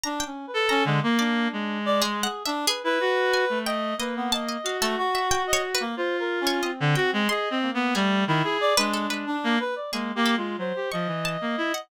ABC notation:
X:1
M:6/4
L:1/16
Q:1/4=91
K:none
V:1 name="Clarinet"
z3 A2 D, ^A,3 ^G,5 z3 E ^F3 =A,3 | ^A,4 ^F8 =F5 D, ^F ^G, (3^G2 C2 B,2 | G,2 ^D, ^G2 =D4 ^A, z2 (3A,2 A,2 ^G,2 ^F, =G =F, E,2 A, E z |]
V:2 name="Pizzicato Strings"
^a g z2 a2 z d z4 (3^G2 ^f2 e2 G4 ^g2 =g2 | ^d2 a d f A2 e (3g2 ^c2 B2 z3 c d2 g2 =c' z3 | ^G4 z B A B z4 G2 A2 z2 ^c' z a3 ^f |]
V:3 name="Clarinet"
(3D2 ^C2 B2 C ^G, ^A, D4 d (3G,2 ^G2 D2 B B5 ^d2 | B B, ^d3 A, ^F3 d z ^A, (3c2 ^A2 ^C2 =C4 d2 A,2 | A,2 E2 d ^G,2 G, D2 B d (3G,2 =G2 F2 c2 ^d6 |]